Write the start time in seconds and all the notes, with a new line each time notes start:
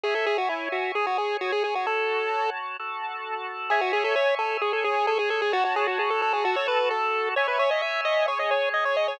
0.04 G#4 C#5 E5 G#5
0.15 A4
0.26 G#4
0.38 F#4
0.49 E4
0.72 F#4
0.95 G#4 C#5 G#5
1.07 F#4
1.18 G#4
1.41 F#4
1.52 G#4
1.64 G#4
1.75 F#4
1.86 F#4 A4 C#5 A5
2.79 F#4 A4 A5
3.70 G#4 C#5 E5 G#5
3.81 F#4
3.93 G#4
4.04 A4
4.16 C#5
4.39 A4
4.61 G#4 C#5 G#5
4.73 A4
4.84 G#4
5.07 A4
5.19 G#4
5.30 A4
5.42 G#4
5.52 F#4 C#5 A5
5.65 F#4
5.76 G#4
5.87 F#4
5.99 G#4
6.10 A4
6.22 A4
6.33 G#4
6.44 F#4 A4 A5
6.56 C#5
6.68 B4
6.91 A4
7.36 C#5 E5 G#5
7.48 B4
7.59 C#5
7.71 D#5
7.82 E5
8.05 D#5
8.28 G#4 C#5 G#5
8.39 D#5
8.51 C#5
8.74 D#5
8.85 C#5
8.97 D#5
9.08 C#5